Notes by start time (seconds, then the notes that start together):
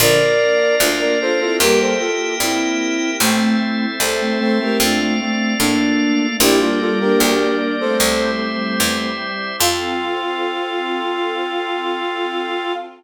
0.00 A#1 D3 F3 A#3 D4 F4 A#4 D5 F5
0.80 D2 D4 F4
1.00 A#4 D5
1.20 D4 F4 A4 C5
1.40 C4 E4 F4 A4
1.60 E2 G3 A#3 E4 G4 A#4 E5 G5
1.80 A4 C5
2.00 F4 A4
2.40 G2 C4 E4
3.20 A1 A3 C4 E4 A4 C5 E5
4.00 C2 A4 C5
4.21 A3 C4
4.40 A3 C4 A4 C5
4.59 A3 C4 G4 A#4
4.79 F2 A3 C4 D4 F4 A4 D5 F5
5.00 A3 C4
5.20 A3 C4
5.59 A2 A#3 D4
6.40 A#1 G3 A#3 D4 E4 G4 A#4 D5
6.60 G3 A#3 D4 F4
6.80 F4 A4
7.00 A#3 D4 G4 A#4
7.20 D2 G4 A#4
7.80 A3 C4 A4 C5
8.00 C2 G3 C4 E4 G4 C5 E5
8.80 E2
9.60 F2 C4 F4 A4 F5